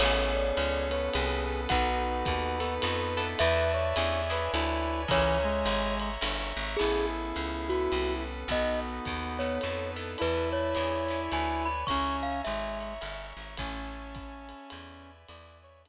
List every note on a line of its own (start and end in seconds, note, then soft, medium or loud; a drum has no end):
0.00 0.52 A1 medium
0.00 0.43 B3 loud
0.00 0.90 B3 medium
0.00 0.43 C#4 loud
0.00 0.90 C#4 medium
0.00 0.43 G#4 loud
0.00 0.90 G#4 medium
0.00 0.43 A4 loud
0.00 0.90 A4 medium
0.00 0.32 C#5 loud
0.00 1.44 C#5 loud
0.00 crash loud
0.00 ride loud
0.35 0.84 D5 medium
0.57 1.09 C#2 medium
0.57 hi-hat pedal loud
0.57 ride loud
0.90 1.69 B3 medium
0.90 1.69 C#4 medium
0.90 1.69 A4 medium
0.90 1.69 B4 medium
0.90 1.09 C#5 medium
0.90 ride medium
1.13 1.67 C2 medium
1.13 1.61 G#4 medium
1.13 ride loud
1.69 2.23 B1 medium
1.69 2.13 B3 loud
1.69 2.59 B3 medium
1.69 2.13 D#4 loud
1.69 2.59 D#4 medium
1.69 2.13 F#4 loud
1.69 2.59 F#4 medium
1.69 2.13 A4 loud
1.69 2.59 A4 medium
1.69 3.21 B4 medium
1.69 2.75 F#5 loud
1.69 kick medium
1.69 ride loud
2.25 2.79 D#2 medium
2.25 kick medium
2.25 hi-hat pedal loud
2.25 ride medium
2.60 2.76 B3 medium
2.60 3.39 B3 medium
2.60 2.76 D#4 medium
2.60 3.39 D#4 medium
2.60 2.76 F#4 loud
2.60 2.76 A4 loud
2.60 3.39 A4 medium
2.60 3.39 B4 medium
2.60 ride medium
2.82 3.35 F2 medium
2.82 3.15 B3 medium
2.82 3.15 D#4 medium
2.82 3.15 F#4 loud
2.82 3.15 A4 medium
2.82 ride loud
3.17 3.83 B3 loud
3.17 3.83 D4 loud
3.17 3.83 E4 loud
3.17 3.83 A4 loud
3.39 3.94 E2 medium
3.39 3.96 B4 medium
3.39 3.71 B4 medium
3.39 3.96 D5 medium
3.39 3.96 E5 medium
3.39 4.92 E5 loud
3.39 3.96 A5 medium
3.39 ride loud
3.73 4.20 C#5 medium
3.96 4.49 E2 medium
3.96 4.21 C#4 loud
3.96 4.21 D4 loud
3.96 4.21 E4 loud
3.96 4.21 G#4 loud
3.96 4.52 C#5 medium
3.96 4.52 D5 medium
3.96 4.52 E5 medium
3.96 4.52 G#5 medium
3.96 hi-hat pedal medium
3.96 ride loud
4.30 4.66 C#4 medium
4.30 4.66 D4 medium
4.30 4.66 E4 loud
4.30 4.66 G#4 medium
4.30 4.52 B4 medium
4.30 ride medium
4.52 5.06 D2 medium
4.52 5.02 E4 medium
4.52 5.09 B4 medium
4.52 5.08 C#5 medium
4.52 5.09 D5 medium
4.52 5.08 G#5 medium
4.52 ride loud
5.08 5.64 C#2 medium
5.08 5.37 E3 loud
5.08 5.52 C#4 loud
5.08 5.52 E4 loud
5.08 5.52 G#4 loud
5.08 5.52 A#4 loud
5.08 5.99 C#5 medium
5.08 5.95 C#5 loud
5.08 5.99 E5 medium
5.08 5.99 G#5 medium
5.08 5.99 A#5 medium
5.08 kick medium
5.08 ride loud
5.44 6.10 G#3 medium
5.65 6.18 G#1 medium
5.65 hi-hat pedal medium
5.65 ride loud
6.00 6.79 C#5 medium
6.00 6.79 E5 medium
6.00 6.79 A#5 medium
6.00 6.79 C#6 medium
6.00 ride medium
6.21 6.53 G1 medium
6.21 6.65 C#4 medium
6.21 6.65 E4 medium
6.21 6.65 G#4 medium
6.21 6.65 A#4 medium
6.21 ride loud
6.56 6.77 G#1 medium
6.77 7.22 B3 medium
6.77 7.69 B3 medium
6.77 7.22 C#4 medium
6.77 7.69 C#4 medium
6.77 8.23 E4 medium
6.77 7.06 G#4 medium
6.77 7.22 G#4 medium
6.77 7.69 G#4 medium
6.77 7.22 A4 medium
6.77 7.69 A4 medium
6.77 crash medium
6.77 ride medium
6.81 7.33 A1 medium
7.35 7.88 C#2 medium
7.35 hi-hat pedal medium
7.35 ride medium
7.69 8.48 B3 medium
7.69 8.48 C#4 medium
7.69 8.14 F#4 medium
7.69 8.48 A4 medium
7.69 8.48 B4 medium
7.69 ride medium
7.92 8.44 C2 medium
7.92 ride medium
8.48 9.00 B1 medium
8.48 8.92 B3 medium
8.48 9.39 B3 medium
8.48 9.59 B3 medium
8.48 8.92 D#4 medium
8.48 9.39 D#4 medium
8.48 8.92 F#4 medium
8.48 9.39 F#4 medium
8.48 8.92 A4 medium
8.48 9.39 A4 medium
8.48 8.80 D#5 medium
8.48 kick medium
8.48 ride medium
9.05 9.59 D#2 medium
9.05 kick medium
9.05 hi-hat pedal medium
9.05 ride medium
9.39 10.18 B3 medium
9.39 9.55 B3 medium
9.39 10.18 D#4 medium
9.39 9.55 D#4 medium
9.39 9.55 F#4 medium
9.39 10.18 A4 medium
9.39 9.55 A4 medium
9.39 10.18 B4 medium
9.39 9.91 C#5 medium
9.39 ride medium
9.61 10.16 F2 medium
9.61 9.96 B3 medium
9.61 9.96 D#4 medium
9.61 9.96 F#4 medium
9.61 9.96 A4 medium
9.61 ride medium
9.96 10.62 B3 medium
9.96 10.62 D4 medium
9.96 10.62 E4 medium
9.96 10.62 A4 medium
10.18 10.75 E2 medium
10.18 11.67 E4 medium
10.18 10.75 B4 medium
10.18 10.49 B4 medium
10.18 10.75 D5 medium
10.18 10.75 E5 medium
10.18 10.75 A5 medium
10.18 ride medium
10.53 11.21 C#5 medium
10.75 11.29 E2 medium
10.75 10.99 C#4 medium
10.75 10.99 D4 medium
10.75 10.99 E4 medium
10.75 10.99 G#4 medium
10.75 11.31 C#5 medium
10.75 11.31 D5 medium
10.75 11.32 E5 medium
10.75 11.31 G#5 medium
10.75 hi-hat pedal medium
10.75 ride medium
11.08 11.46 C#4 medium
11.08 11.46 D4 medium
11.08 11.46 E4 medium
11.08 11.46 G#4 medium
11.08 ride medium
11.32 11.84 D2 medium
11.32 11.88 B4 medium
11.32 11.88 C#5 medium
11.32 11.88 D5 medium
11.32 11.88 G#5 medium
11.32 11.63 G#5 medium
11.32 ride medium
11.65 11.85 B5 medium
11.87 12.42 C#2 medium
11.87 12.31 C#4 medium
11.87 12.41 C#4 medium
11.87 12.31 E4 medium
11.87 12.31 G#4 medium
11.87 12.31 A#4 medium
11.87 12.79 C#5 medium
11.87 12.79 E5 medium
11.87 12.79 G#5 medium
11.87 12.79 A#5 medium
11.87 12.17 C#6 medium
11.87 kick medium
11.87 ride medium
12.23 12.41 F5 medium
12.44 12.99 G#1 medium
12.44 12.93 G#3 medium
12.44 13.26 E5 medium
12.44 hi-hat pedal medium
12.44 ride medium
12.80 13.58 C#5 medium
12.80 13.58 E5 medium
12.80 13.58 A#5 medium
12.80 13.58 C#6 medium
12.80 ride medium
13.01 13.33 G1 medium
13.01 13.44 C#4 medium
13.01 13.44 E4 medium
13.01 13.44 G#4 medium
13.01 13.44 A#4 medium
13.01 ride medium
13.37 13.57 G#1 soft
13.57 14.54 A1 medium
13.57 15.10 C#4 medium
13.57 14.71 C#5 medium
13.57 14.71 E5 medium
13.57 14.71 G#5 medium
13.57 14.71 A5 medium
13.57 kick medium
13.57 ride loud
14.15 kick medium
14.15 hi-hat pedal medium
14.15 ride medium
14.49 ride medium
14.70 15.25 E2 medium
14.70 15.28 B4 medium
14.70 15.28 D5 medium
14.70 15.28 E5 medium
14.70 15.28 G#5 medium
14.70 ride loud
15.28 15.89 E2 medium
15.28 15.89 B4 medium
15.28 15.58 D5 medium
15.28 15.89 D5 medium
15.28 15.89 E5 medium
15.28 15.89 G#5 medium
15.28 ride loud
15.63 15.82 C#5 medium
15.85 15.89 D4 medium
15.85 hi-hat pedal loud
15.85 ride loud